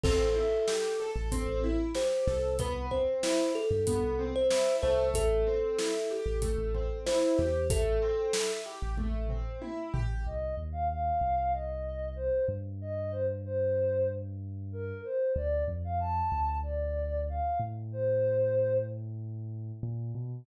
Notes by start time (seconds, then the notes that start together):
0.03 A1 C4 A4, kick, crash
0.36 E4
0.68 G4, snare
1.00 A4
1.16 A1
1.32 C4, kick, closed hi-hat
1.48 A1
1.64 E4
1.95 G4 C5, snare
2.27 C2 A4, snare
2.59 B3 B4, kick, closed hi-hat
2.91 C4 C5, kick
3.23 E4, snare
3.55 G4 A4
3.71 G2
3.87 B3, kick, closed hi-hat
4.03 C2
4.19 C4
4.36 C5
4.51 E4, snare
4.82 C2 A3 C5, snare
5.14 A1 A4, kick, closed hi-hat
5.47 C4
5.79 E4, snare
6.11 G4
6.26 A1
6.42 A3, kick, closed hi-hat
6.58 A1
6.74 C4, kick
7.06 E4 C5, snare
7.38 E2 G4, snare
7.70 A1 A3 A4, kick, closed hi-hat
8.02 C4
8.33 E4, snare
8.66 G4
8.82 A1
8.97 A3, kick, high tom
9.14 A1
9.28 C4, floor tom
9.62 E4, high tom
9.94 A1 G4, floor tom
10.26 C2 D#5
10.57 D#2
10.72 F5
10.89 F5
11.21 C2
11.53 D#5
12.16 C5
12.48 G2
12.81 D#5
13.11 C5
13.45 C5
14.72 A#4
15.04 C5
15.36 D2 D5
15.68 F2
15.84 F5
16.00 A5
16.32 D2
16.63 D5
17.29 F5
17.60 A2
17.92 C5
19.83 A#2
20.15 B2